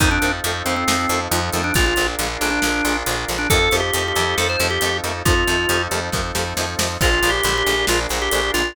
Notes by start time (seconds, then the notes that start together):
0.00 F2 D#3 F3 A3 C4 D#4 F4 A4, kick, closed hi-hat
0.11 D4
0.22 F2 D#3 F3 A3 C4, closed hi-hat
0.44 F2 D#3 F3 A3 C4, closed hi-hat
0.66 F2 D#3 F3 A3 C4, closed hi-hat
0.70 C4
0.76 C4
0.88 F2 D#3 F3 A3 C4, snare
1.09 F2 D#3 F3 A3, closed hi-hat
1.13 C4
1.31 F2 D#3 F3 A3 C4, closed hi-hat
1.52 F2 D#3 F3 A3, closed hi-hat
1.57 C4
1.64 D4
1.74 A#1 D3 F3 G#3 D4 F4 G#4 A#4, kick, closed hi-hat
1.79 A#3
1.86 F4
1.96 A#1 D3 F3 G#3, closed hi-hat
2.01 A#3
2.19 A#1 D3 F3 G#3, closed hi-hat
2.23 A#3
2.41 A#1 D3 F3 G#3 A#3 D4, closed hi-hat
2.50 D4
2.62 A#1 D3 F3 G#3, snare
2.67 A#3
2.85 A#1 D3 F3 G#3 A#3, closed hi-hat
3.06 A#1 D3 F3 G#3, closed hi-hat
3.10 A#3
3.28 A#1 D3 F3 G#3 A#3, closed hi-hat
3.38 D4
3.50 F2 C3 D#3 F3 C4 D#4 F4 A4, kick, closed hi-hat
3.54 A3
3.71 F2 C3 D#3 F3, closed hi-hat
3.76 A3 G4
3.94 F2 C3 D#3 F3, closed hi-hat
3.98 A3
4.08 G4
4.16 F2 C3 D#3 F3, closed hi-hat
4.20 A3
4.37 F2 C3 D#3 F3 A4, snare
4.42 A3
4.49 C5
4.59 F2 C3 D#3 F3, closed hi-hat
4.64 A3
4.70 G4
4.81 F2 C3 D#3 F3, closed hi-hat
4.86 A3
5.04 F2 C3 D#3 F3 A3, closed hi-hat
5.25 F2 C3 D#3 F3 C4 D#4 F4 A4, kick, closed hi-hat
5.29 A3
5.47 F2 C3 D#3 F3 A3, closed hi-hat
5.69 F2 C3 D#3 F3, closed hi-hat
5.73 A3
5.91 F2 C3 D#3 F3, closed hi-hat
5.95 A3
6.12 F2 C3 D#3 F3, kick, snare
6.17 A3
6.35 F2 C3 D#3 F3 A3, snare
6.57 F2 C3 D#3 F3 A3, snare
6.79 F2 C3 D#3 F3 A3, snare
7.00 A#1 D3 F3 G#3 D4 F4 G#4 A#4, kick, crash
7.05 A#3
7.23 A#1 D3 F3 G#3 A#3, closed hi-hat
7.30 G4
7.43 A#1 D3 F3 G#3, closed hi-hat
7.48 A#3
7.58 G4
7.66 A#1 D3 F3 G#3 A#3, closed hi-hat
7.87 A#1 D3 F3 G#3 F4, snare
7.92 A#3
8.09 A#1 D3 F3 G#3, closed hi-hat
8.14 A#3
8.22 G4
8.31 A#1 D3 F3 G#3, closed hi-hat
8.36 A#3
8.54 A#1 D3 F3 G#3 F4, closed hi-hat
8.58 A#3